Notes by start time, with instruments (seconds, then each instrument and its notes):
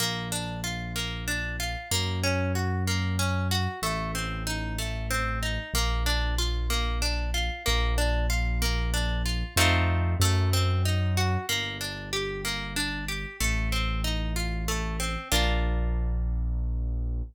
0.00 acoustic grand piano A#1, orchestral harp A#3
0.32 orchestral harp D4
0.64 orchestral harp F4
0.96 orchestral harp A#3
1.28 orchestral harp D4
1.60 orchestral harp F4
1.91 acoustic grand piano F#2, orchestral harp A#3
2.24 orchestral harp C#4
2.55 orchestral harp F#4
2.87 orchestral harp A#3
3.19 orchestral harp C#4
3.51 orchestral harp F#4
3.82 acoustic grand piano A1, orchestral harp A3
4.15 orchestral harp C4
4.47 orchestral harp D#4
4.78 orchestral harp A3
5.11 orchestral harp C4
5.43 orchestral harp D#4
5.74 acoustic grand piano A#1, orchestral harp A#3
6.06 orchestral harp D4
6.38 orchestral harp F4
6.70 orchestral harp A#3
7.02 orchestral harp D4
7.34 orchestral harp F4
7.66 acoustic grand piano A#1, orchestral harp A#3
7.98 orchestral harp D4
8.30 orchestral harp F4
8.62 orchestral harp A#3
8.94 orchestral harp D4
9.26 orchestral harp F4
9.56 acoustic grand piano F2, orchestral harp A3 C4 D#4 F4
10.20 acoustic grand piano F#2, orchestral harp A3
10.53 orchestral harp C4
10.85 orchestral harp D#4
11.17 orchestral harp F#4
11.49 acoustic grand piano G1, orchestral harp A#3
11.81 orchestral harp D4
12.13 orchestral harp G4
12.45 orchestral harp A#3
12.76 orchestral harp D4
13.08 orchestral harp G4
13.40 acoustic grand piano A1, orchestral harp A3
13.72 orchestral harp C4
14.04 orchestral harp D#4
14.36 orchestral harp F4
14.68 orchestral harp A3
15.00 orchestral harp C4
15.32 acoustic grand piano A#1, orchestral harp A#3 D4 F4